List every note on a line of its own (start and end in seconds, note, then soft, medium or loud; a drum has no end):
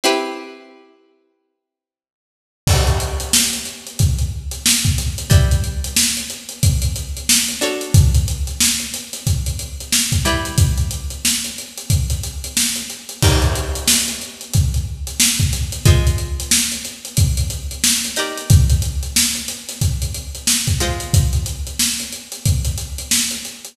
0.04 2.63 C4 medium
0.04 2.63 E4 medium
0.04 2.63 G4 medium
0.04 2.63 B4 medium
2.67 5.27 D4 medium
2.67 5.27 F#4 medium
2.67 5.27 A4 medium
2.67 5.27 C#5 medium
2.67 kick medium
2.67 crash medium
2.87 closed hi-hat medium
3.00 closed hi-hat medium
3.20 closed hi-hat medium
3.33 snare loud
3.53 closed hi-hat medium
3.65 closed hi-hat medium
3.87 closed hi-hat medium
3.99 kick medium
3.99 closed hi-hat medium
4.18 closed hi-hat medium
4.51 closed hi-hat medium
4.66 snare loud
4.84 kick medium
4.84 closed hi-hat medium
4.98 snare soft
4.98 closed hi-hat medium
5.18 closed hi-hat medium
5.30 7.51 G3 medium
5.30 7.51 E4 medium
5.30 7.51 B4 medium
5.30 7.51 D5 medium
5.30 kick medium
5.30 closed hi-hat medium
5.51 closed hi-hat medium
5.64 closed hi-hat medium
5.84 closed hi-hat medium
5.96 snare loud
6.17 closed hi-hat medium
6.30 closed hi-hat medium
6.49 closed hi-hat medium
6.63 kick medium
6.63 closed hi-hat medium
6.82 closed hi-hat medium
6.96 closed hi-hat medium
7.16 closed hi-hat medium
7.29 snare loud
7.48 closed hi-hat medium
7.61 10.14 D4 medium
7.61 10.14 F#4 medium
7.61 10.14 A4 medium
7.61 10.14 C#5 medium
7.61 closed hi-hat medium
7.81 closed hi-hat medium
7.94 kick loud
7.94 closed hi-hat medium
8.14 closed hi-hat medium
8.28 closed hi-hat medium
8.47 closed hi-hat medium
8.60 snare medium
8.79 closed hi-hat medium
8.93 snare soft
8.93 closed hi-hat medium
9.13 snare soft
9.13 closed hi-hat medium
9.27 kick medium
9.27 closed hi-hat medium
9.46 closed hi-hat medium
9.59 closed hi-hat medium
9.80 closed hi-hat medium
9.92 snare medium
10.12 kick medium
10.12 closed hi-hat medium
10.25 13.17 G3 medium
10.25 13.17 E4 medium
10.25 13.17 B4 medium
10.25 13.17 D5 medium
10.25 closed hi-hat medium
10.45 closed hi-hat medium
10.58 kick medium
10.58 closed hi-hat medium
10.77 closed hi-hat medium
10.91 closed hi-hat medium
11.10 closed hi-hat medium
11.25 snare medium
11.44 closed hi-hat medium
11.58 closed hi-hat medium
11.77 closed hi-hat medium
11.90 kick medium
11.90 closed hi-hat medium
12.10 closed hi-hat medium
12.23 closed hi-hat medium
12.44 closed hi-hat medium
12.57 snare medium
12.76 closed hi-hat medium
12.90 closed hi-hat medium
13.09 closed hi-hat medium
13.22 15.82 D#4 medium
13.22 15.82 G4 medium
13.22 15.82 A#4 medium
13.22 15.82 D5 medium
13.22 kick medium
13.22 crash medium
13.42 closed hi-hat medium
13.55 closed hi-hat medium
13.75 closed hi-hat medium
13.88 snare loud
14.08 closed hi-hat medium
14.21 closed hi-hat medium
14.41 closed hi-hat medium
14.53 kick medium
14.53 closed hi-hat medium
14.74 closed hi-hat medium
15.07 closed hi-hat medium
15.20 snare loud
15.40 kick medium
15.40 closed hi-hat medium
15.52 snare soft
15.52 closed hi-hat medium
15.72 closed hi-hat medium
15.85 18.07 G#3 medium
15.85 18.07 F4 medium
15.85 18.07 C5 medium
15.85 18.07 D#5 medium
15.85 kick medium
15.85 closed hi-hat medium
16.07 closed hi-hat medium
16.18 closed hi-hat medium
16.40 closed hi-hat medium
16.51 snare loud
16.72 closed hi-hat medium
16.85 closed hi-hat medium
17.05 closed hi-hat medium
17.17 kick medium
17.17 closed hi-hat medium
17.37 closed hi-hat medium
17.50 closed hi-hat medium
17.71 closed hi-hat medium
17.84 snare loud
18.04 closed hi-hat medium
18.16 20.70 D#4 medium
18.16 20.70 G4 medium
18.16 20.70 A#4 medium
18.16 20.70 D5 medium
18.16 closed hi-hat medium
18.37 closed hi-hat medium
18.50 kick loud
18.50 closed hi-hat medium
18.70 closed hi-hat medium
18.82 closed hi-hat medium
19.03 closed hi-hat medium
19.16 snare medium
19.35 closed hi-hat medium
19.48 snare soft
19.48 closed hi-hat medium
19.69 snare soft
19.69 closed hi-hat medium
19.81 kick medium
19.81 closed hi-hat medium
20.02 closed hi-hat medium
20.14 closed hi-hat medium
20.35 closed hi-hat medium
20.47 snare medium
20.67 kick medium
20.67 closed hi-hat medium
20.80 23.73 G#3 medium
20.80 23.73 F4 medium
20.80 23.73 C5 medium
20.80 23.73 D#5 medium
20.80 closed hi-hat medium
21.00 closed hi-hat medium
21.13 kick medium
21.13 closed hi-hat medium
21.33 closed hi-hat medium
21.46 closed hi-hat medium
21.67 closed hi-hat medium
21.79 snare medium
21.99 closed hi-hat medium
22.12 closed hi-hat medium
22.32 closed hi-hat medium
22.45 kick medium
22.45 closed hi-hat medium
22.65 closed hi-hat medium
22.77 closed hi-hat medium
22.98 closed hi-hat medium
23.11 snare medium
23.31 closed hi-hat medium
23.45 closed hi-hat medium
23.65 closed hi-hat medium